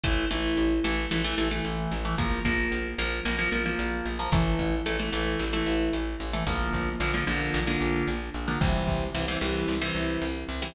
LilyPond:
<<
  \new Staff \with { instrumentName = "Overdriven Guitar" } { \time 4/4 \key a \phrygian \tempo 4 = 112 <e a>8 <e a>4 <e a>8 <e a>16 <e a>16 <e a>16 <e a>4 <e a>16 | <f bes>8 <f bes>4 <f bes>8 <f bes>16 <f bes>16 <f bes>16 <f bes>4 <f bes>16 | <e a>4 <e a>16 <e a>16 <e a>8. <e a>4. <e a>16 | <d f bes>4 <d f bes>16 <d f bes>16 <d f bes>8. <d f bes>4. <d f bes>16 |
<c e g>4 <c e g>16 <c e g>16 <c e g>8. <c e g>4. <c e g>16 | }
  \new Staff \with { instrumentName = "Electric Bass (finger)" } { \clef bass \time 4/4 \key a \phrygian a,,8 a,,8 a,,8 a,,8 a,,8 a,,8 a,,8 a,,8 | bes,,8 bes,,8 bes,,8 bes,,8 bes,,8 bes,,8 bes,,8 bes,,8 | a,,8 a,,8 a,,8 a,,8 a,,8 a,,8 a,,8 a,,8 | bes,,8 bes,,8 bes,,8 bes,,8 bes,,8 bes,,8 bes,,8 bes,,8 |
c,8 c,8 c,8 c,8 c,8 c,8 c,8 c,8 | }
  \new DrumStaff \with { instrumentName = "Drums" } \drummode { \time 4/4 <hh bd>4 hh8 hh8 sn8 hh8 hh8 hho8 | <hh bd>8 <hh bd>8 hh8 hh8 sn8 hh8 hh8 hh8 | <hh bd>8 <hh bd>8 hh8 hh8 sn8 hh8 hh8 hh8 | <hh bd>8 <hh bd>8 hh8 hh8 sn8 hh8 hh8 hh8 |
<hh bd>8 <hh bd>8 hh8 hh8 sn8 hh8 hh8 hho8 | }
>>